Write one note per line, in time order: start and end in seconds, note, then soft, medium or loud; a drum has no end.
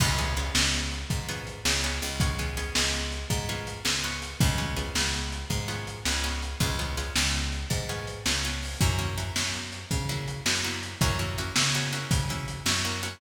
0.00 0.50 C#2 medium
0.00 0.17 B3 loud
0.00 0.17 C#4 loud
0.00 0.17 F4 loud
0.00 0.17 G#4 loud
0.00 kick medium
0.00 crash loud
0.18 0.35 B3 medium
0.18 0.35 C#4 medium
0.18 0.35 F4 medium
0.18 0.35 G#4 medium
0.18 closed hi-hat medium
0.36 1.21 B3 medium
0.36 1.21 C#4 medium
0.36 1.21 F4 medium
0.36 1.21 G#4 medium
0.36 closed hi-hat medium
0.55 1.05 C#2 medium
0.55 snare loud
0.74 closed hi-hat medium
0.92 closed hi-hat medium
1.10 1.60 G#2 medium
1.10 kick medium
1.10 closed hi-hat medium
1.28 1.62 B3 medium
1.28 1.62 C#4 medium
1.28 1.62 F4 medium
1.28 1.62 G#4 medium
1.28 closed hi-hat medium
1.47 closed hi-hat medium
1.65 2.00 C#2 medium
1.65 1.82 B3 medium
1.65 1.82 C#4 medium
1.65 1.82 F4 medium
1.65 1.82 G#4 medium
1.65 snare loud
1.83 2.18 B3 medium
1.83 2.18 C#4 medium
1.83 2.18 F4 medium
1.83 2.18 G#4 medium
1.83 closed hi-hat medium
2.02 2.70 C#2 medium
2.02 closed hi-hat medium
2.20 2.38 B3 medium
2.20 2.38 C#4 medium
2.20 2.38 F4 medium
2.20 2.38 G#4 medium
2.20 kick medium
2.20 closed hi-hat medium
2.38 2.56 B3 medium
2.38 2.56 C#4 medium
2.38 2.56 F4 medium
2.38 2.56 G#4 medium
2.38 closed hi-hat medium
2.57 3.42 B3 medium
2.57 3.42 C#4 medium
2.57 3.42 F4 medium
2.57 3.42 G#4 medium
2.57 closed hi-hat medium
2.75 3.25 C#2 medium
2.75 snare loud
2.93 closed hi-hat medium
3.12 closed hi-hat medium
3.30 3.80 G#2 medium
3.30 kick medium
3.30 closed hi-hat medium
3.49 3.83 B3 medium
3.49 3.83 C#4 medium
3.49 3.83 F4 medium
3.49 3.83 G#4 medium
3.49 closed hi-hat medium
3.67 closed hi-hat medium
3.85 4.35 C#2 medium
3.85 4.02 B3 medium
3.85 4.02 C#4 medium
3.85 4.02 F4 medium
3.85 4.02 G#4 medium
3.85 snare medium
4.04 4.38 B3 medium
4.04 4.38 C#4 medium
4.04 4.38 F4 medium
4.04 4.38 G#4 medium
4.04 closed hi-hat medium
4.22 closed hi-hat medium
4.40 4.90 C#2 medium
4.40 4.57 B3 medium
4.40 4.57 C#4 medium
4.40 4.57 F4 loud
4.40 4.57 G#4 medium
4.40 kick loud
4.40 closed hi-hat medium
4.58 4.75 B3 medium
4.58 4.75 C#4 medium
4.58 4.75 F4 medium
4.58 4.75 G#4 medium
4.58 closed hi-hat medium
4.76 5.61 B3 medium
4.76 5.61 C#4 medium
4.76 5.61 F4 medium
4.76 5.61 G#4 medium
4.76 closed hi-hat medium
4.95 5.45 C#2 medium
4.95 snare medium
5.13 closed hi-hat medium
5.32 closed hi-hat medium
5.50 5.99 G#2 medium
5.50 kick medium
5.50 closed hi-hat medium
5.68 6.02 B3 medium
5.68 6.02 C#4 medium
5.68 6.02 F4 medium
5.68 6.02 G#4 medium
5.68 closed hi-hat medium
5.87 closed hi-hat medium
6.05 6.55 C#2 medium
6.05 6.23 B3 medium
6.05 6.23 C#4 medium
6.05 6.23 F4 medium
6.05 6.23 G#4 medium
6.05 snare medium
6.24 6.58 B3 medium
6.24 6.58 C#4 medium
6.24 6.58 F4 medium
6.24 6.58 G#4 medium
6.24 closed hi-hat medium
6.42 closed hi-hat medium
6.60 7.10 C#2 medium
6.60 6.77 B3 medium
6.60 6.77 C#4 medium
6.60 6.77 F4 medium
6.60 6.77 G#4 loud
6.60 kick medium
6.60 closed hi-hat medium
6.79 6.96 B3 medium
6.79 6.96 C#4 medium
6.79 6.96 F4 medium
6.79 6.96 G#4 medium
6.79 closed hi-hat medium
6.97 7.82 B3 medium
6.97 7.82 C#4 medium
6.97 7.82 F4 medium
6.97 7.82 G#4 medium
6.97 closed hi-hat medium
7.16 7.65 C#2 medium
7.16 snare loud
7.34 closed hi-hat medium
7.52 closed hi-hat medium
7.70 8.20 G#2 medium
7.70 kick medium
7.70 closed hi-hat medium
7.89 8.23 B3 medium
7.89 8.23 C#4 medium
7.89 8.23 F4 medium
7.89 8.23 G#4 medium
7.89 closed hi-hat medium
8.07 closed hi-hat medium
8.26 8.76 C#2 medium
8.26 8.43 B3 medium
8.26 8.43 C#4 medium
8.26 8.43 F4 medium
8.26 8.43 G#4 medium
8.26 snare medium
8.44 8.79 B3 medium
8.44 8.79 C#4 medium
8.44 8.79 F4 medium
8.44 8.79 G#4 medium
8.44 closed hi-hat medium
8.62 open hi-hat medium
8.81 9.31 F#2 medium
8.81 8.97 A#3 loud
8.81 8.97 C#4 medium
8.81 8.97 E4 medium
8.81 8.97 F#4 medium
8.81 kick medium
8.81 closed hi-hat medium
8.99 9.15 A#3 medium
8.99 9.15 C#4 medium
8.99 9.15 E4 medium
8.99 9.15 F#4 medium
8.99 closed hi-hat medium
9.18 10.02 A#3 medium
9.18 10.02 C#4 medium
9.18 10.02 E4 medium
9.18 10.02 F#4 medium
9.18 closed hi-hat medium
9.36 9.85 F#2 medium
9.36 snare medium
9.54 closed hi-hat medium
9.72 closed hi-hat medium
9.91 10.41 C#3 medium
9.91 kick medium
9.91 closed hi-hat medium
10.09 10.43 A#3 medium
10.09 10.43 C#4 loud
10.09 10.43 E4 medium
10.09 10.43 F#4 medium
10.09 closed hi-hat medium
10.28 closed hi-hat medium
10.46 10.95 F#2 medium
10.46 10.63 A#3 medium
10.46 10.63 C#4 medium
10.46 10.63 E4 medium
10.46 10.63 F#4 medium
10.46 snare medium
10.64 10.98 A#3 medium
10.64 10.98 C#4 medium
10.64 10.98 E4 loud
10.64 10.98 F#4 medium
10.64 closed hi-hat medium
10.83 closed hi-hat medium
11.01 11.51 F#2 medium
11.01 11.18 A#3 loud
11.01 11.18 C#4 loud
11.01 11.18 E4 medium
11.01 11.18 F#4 medium
11.01 kick medium
11.01 closed hi-hat medium
11.19 11.36 A#3 medium
11.19 11.36 C#4 medium
11.19 11.36 E4 medium
11.19 11.36 F#4 medium
11.19 closed hi-hat medium
11.38 11.55 A#3 medium
11.38 11.55 C#4 medium
11.38 11.55 E4 medium
11.38 11.55 F#4 medium
11.38 closed hi-hat medium
11.56 12.05 C#3 medium
11.56 11.73 A#3 medium
11.56 11.73 C#4 medium
11.56 11.73 E4 medium
11.56 11.73 F#4 medium
11.56 snare loud
11.74 11.92 A#3 medium
11.74 11.92 C#4 medium
11.74 11.92 E4 medium
11.74 11.92 F#4 medium
11.74 closed hi-hat medium
11.93 12.26 A#3 medium
11.93 12.26 C#4 medium
11.93 12.26 E4 medium
11.93 12.26 F#4 medium
11.93 closed hi-hat medium
12.11 12.60 C#3 medium
12.11 kick medium
12.11 closed hi-hat loud
12.29 12.64 A#3 medium
12.29 12.64 C#4 medium
12.29 12.64 E4 medium
12.29 12.64 F#4 medium
12.29 closed hi-hat medium
12.48 closed hi-hat medium
12.66 13.15 F#2 medium
12.66 12.83 A#3 medium
12.66 12.83 C#4 medium
12.66 12.83 E4 medium
12.66 12.83 F#4 medium
12.66 snare loud
12.84 13.02 A#3 medium
12.84 13.02 C#4 medium
12.84 13.02 E4 medium
12.84 13.02 F#4 medium
12.84 closed hi-hat medium
13.03 13.20 A#3 medium
13.03 13.20 C#4 medium
13.03 13.20 E4 medium
13.03 13.20 F#4 medium
13.03 closed hi-hat medium